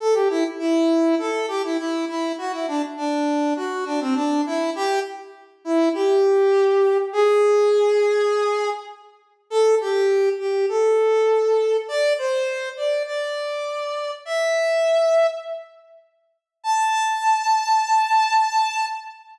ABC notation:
X:1
M:4/4
L:1/16
Q:1/4=101
K:Ador
V:1 name="Brass Section"
A G E z E4 A2 G E E2 E2 | F E D z D4 F2 D C D2 E2 | G2 z4 E2 G8 | ^G12 z4 |
A2 G4 G2 A8 | d2 c4 d2 d8 | e8 z8 | a16 |]